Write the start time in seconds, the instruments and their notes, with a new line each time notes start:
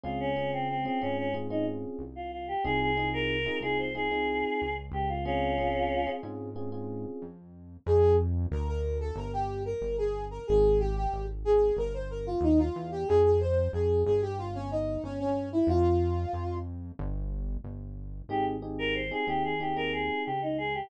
0.04 synth bass 1 C#2, electric piano 1 C4 C#4 F4 G#4, choir aahs F4
0.20 choir aahs C#4
0.36 electric piano 1 C4 C#4 F4 G#4
0.53 choir aahs C4
0.69 choir aahs C4
0.85 electric piano 1 C4 C#4 F4 G#4, choir aahs C4
1.01 synth bass 1 G#2, electric piano 1 C4 C#4 F4 G#4, choir aahs C#4
1.18 choir aahs C#4
1.34 electric piano 1 C4 C#4 F4 G#4
1.50 electric piano 1 C4 C#4 F4 G#4, choir aahs D#4
1.99 synth bass 1 C2
2.16 choir aahs F4
2.32 choir aahs F4
2.48 choir aahs G4
2.64 synth bass 1 C2, electric piano 1 C4 D#4 F4 G#4, choir aahs G#4
2.81 choir aahs G#4
2.97 electric piano 1 C4 D#4 F4 G#4
3.13 choir aahs A#4
3.46 electric piano 1 C4 D#4 F4 G#4
3.60 synth bass 1 C2, electric piano 1 C4 D#4 F4 G#4, choir aahs G#4
3.79 choir aahs C5
3.95 electric piano 1 C4 D#4 F4 G#4, choir aahs G#4
4.11 electric piano 1 C4 D#4 F4 G#4
4.62 synth bass 1 C#2
4.92 synth bass 1 C#2, choir aahs G4
5.09 choir aahs F4
5.25 electric piano 1 C4 C#4 F4 G#4, choir aahs C#4 F4
5.58 electric piano 1 C4 C#4 F4 G#4
6.07 electric piano 1 C4 C#4 F4 G#4
6.23 synth bass 1 G#2, electric piano 1 C4 C#4 F4 G#4
6.56 electric piano 1 C4 C#4 F4 G#4
6.72 electric piano 1 C4 C#4 F4 G#4
7.22 synth bass 1 F2
7.86 synth bass 1 F2, brass section G#4
8.51 synth bass 1 D2, brass section A#4
8.68 brass section A#4
9.00 brass section A4
9.15 synth bass 1 G1, brass section A#4
9.33 brass section G4
9.65 brass section A#4
9.81 synth bass 1 G1
9.98 brass section G#4
10.31 brass section A#4
10.47 synth bass 1 G#1, brass section G#4
10.79 brass section G4
10.96 brass section G4
11.13 synth bass 1 G#1
11.45 brass section G#4
11.77 synth bass 1 G1, brass section A#4
11.94 brass section C5
12.10 brass section A#4
12.26 brass section F4
12.41 synth bass 1 D#2, brass section D#4
12.59 brass section F4
12.76 synth bass 1 E2
12.92 brass section G4
13.08 synth bass 1 F2, brass section G#4
13.24 brass section G#4
13.40 brass section C5
13.73 synth bass 1 F2, brass section G#4
14.06 synth bass 1 G1, brass section G#4
14.22 brass section G4
14.38 brass section F4
14.55 brass section C#4
14.71 brass section D#4
15.03 synth bass 1 G1, brass section C#4
15.20 brass section C#4
15.52 brass section E4
15.67 synth bass 1 F2, brass section F4
16.33 synth bass 1 F2
16.99 synth bass 1 G1
17.64 synth bass 1 G1
18.29 synth bass 1 G#1, electric piano 1 C4 D#4 G4 G#4, choir aahs G4
18.62 electric piano 1 C4 D#4 G4 G#4
18.79 choir aahs A#4
18.95 choir aahs C5
19.11 electric piano 1 C4 D#4 G4 G#4, choir aahs G#4
19.27 synth bass 1 D#2, electric piano 1 C4 D#4 G4 G#4, choir aahs G4
19.44 choir aahs G#4
19.60 electric piano 1 C4 D#4 G4 G#4, choir aahs G4
19.76 electric piano 1 C4 D#4 G4 G#4, choir aahs A#4
19.93 choir aahs G#4
20.25 synth bass 1 C#2, choir aahs G4
20.42 choir aahs D#4
20.58 choir aahs G#4
20.74 choir aahs G4